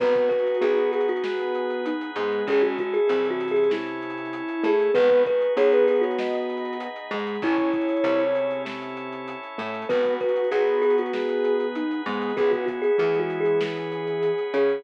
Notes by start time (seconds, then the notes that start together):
0.00 G#1 B3 D#4 F#4 G#4 B4, kick, crash
0.15 kick, closed hi-hat
0.29 B4, kick, closed hi-hat
0.39 closed hi-hat
0.47 closed hi-hat
0.54 closed hi-hat
0.61 B1 B3 G#4, closed hi-hat
0.77 closed hi-hat
0.92 G#4, closed hi-hat
1.00 closed hi-hat
1.08 F#4, closed hi-hat
1.16 closed hi-hat
1.24 B3 D#4 G#4 B4, snare
1.39 closed hi-hat
1.55 closed hi-hat
1.70 closed hi-hat
1.85 D#4, closed hi-hat
2.01 closed hi-hat
2.16 G#2 G#3 B3, closed hi-hat
2.32 closed hi-hat
2.47 A1 G#3 C#4 E4 G#4 A4, kick, closed hi-hat
2.62 F#4, kick, closed hi-hat
2.78 F#4, kick, closed hi-hat
2.93 G#4, closed hi-hat
3.07 C2 C3 F#3 G#4, closed hi-hat
3.25 E3, closed hi-hat
3.31 F#4
3.40 closed hi-hat
3.48 G#4, closed hi-hat
3.56 closed hi-hat
3.64 closed hi-hat
3.70 C#4 E4 A4 C#5, snare
3.87 closed hi-hat
4.02 closed hi-hat
4.10 closed hi-hat
4.18 closed hi-hat
4.25 closed hi-hat
4.33 closed hi-hat
4.48 closed hi-hat
4.64 A2 A3 G#4, closed hi-hat
4.80 closed hi-hat
4.94 G#1 B3 D#4 F#4 G#4 B4, kick, closed hi-hat
5.10 kick, closed hi-hat
5.26 B4, kick, closed hi-hat
5.41 closed hi-hat
5.57 B1 B3 G#4 C#5, closed hi-hat
5.72 B4, closed hi-hat
5.87 G#4, closed hi-hat
5.95 closed hi-hat
6.01 F#4 C#5, closed hi-hat
6.11 closed hi-hat
6.19 B3 D#4 G#4 B4 D#5, snare
6.34 closed hi-hat
6.49 closed hi-hat
6.57 closed hi-hat
6.65 closed hi-hat
6.73 closed hi-hat
6.80 closed hi-hat
6.96 closed hi-hat
7.11 G#2 G#3, closed hi-hat
7.19 closed hi-hat
7.27 closed hi-hat
7.35 closed hi-hat
7.42 A1 C#4 E4 G#4 A4 C#5, kick, closed hi-hat
7.58 kick, closed hi-hat
7.73 kick, closed hi-hat
7.81 closed hi-hat
7.89 closed hi-hat
7.96 closed hi-hat
8.04 C2 C3, closed hi-hat
8.19 closed hi-hat
8.35 closed hi-hat
8.51 closed hi-hat
8.65 C#4 E4 A4 C#5, snare
8.81 snare, closed hi-hat
8.97 closed hi-hat
9.12 closed hi-hat
9.28 closed hi-hat
9.43 closed hi-hat
9.58 A2 A3, closed hi-hat
9.66 closed hi-hat
9.74 closed hi-hat
9.82 closed hi-hat
9.89 G#1 B3 D#4 F#4 G#4 B4, kick, closed hi-hat
10.05 kick, closed hi-hat
10.20 B4, kick, closed hi-hat
10.29 closed hi-hat
10.36 closed hi-hat
10.44 closed hi-hat
10.51 B1 B3 G#4, closed hi-hat
10.67 closed hi-hat
10.82 G#4, snare, closed hi-hat
10.90 closed hi-hat
10.98 F#4, closed hi-hat
11.06 closed hi-hat
11.13 B3 D#4 G#4 B4, snare
11.29 closed hi-hat
11.44 closed hi-hat
11.60 closed hi-hat
11.75 D#4, closed hi-hat
11.91 closed hi-hat
12.06 G#2 G#3 B3, closed hi-hat
12.14 closed hi-hat
12.22 closed hi-hat
12.29 closed hi-hat
12.37 C#2 B3 C#4 E4 G#4, kick, closed hi-hat
12.51 F#4, kick, closed hi-hat
12.66 F#4, kick, closed hi-hat
12.82 G#4, closed hi-hat
12.98 E2 E3 A3 G#4, closed hi-hat
13.14 G#3, closed hi-hat
13.19 F#4
13.30 closed hi-hat
13.40 G#4
13.45 closed hi-hat
13.61 B3 C#4 G#4 B4, snare
13.76 closed hi-hat
13.92 closed hi-hat
14.07 closed hi-hat
14.23 closed hi-hat
14.38 closed hi-hat
14.54 C#3 C#4 G#4, closed hi-hat
14.69 closed hi-hat